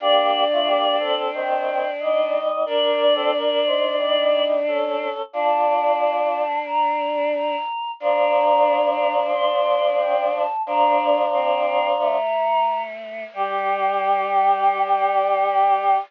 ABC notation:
X:1
M:4/4
L:1/16
Q:1/4=90
K:Gm
V:1 name="Choir Aahs"
d8 g4 e4 | d12 z4 | a8 b4 b4 | b8 c'4 g2 a2 |
b6 b8 z2 | g16 |]
V:2 name="Choir Aahs"
[B,G]3 [A,F] [B,G]2 [CA]2 [E,C]4 [G,E]4 | [DB]3 [CA] [DB]2 [Ec]2 [G,E]4 [^CA]4 | [Fd]8 z8 | [F,D]16 |
[F,D]10 z6 | G16 |]
V:3 name="Choir Aahs"
D16 | D16 | D16 | D16 |
D4 C4 A,8 | G,16 |]